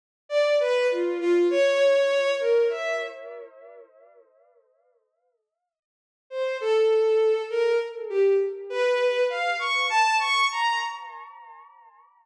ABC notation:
X:1
M:9/8
L:1/16
Q:3/8=33
K:none
V:1 name="Violin"
z d B F F ^c3 ^A e z8 | z3 c A3 ^A z G z B2 f ^c' =a c' ^a |]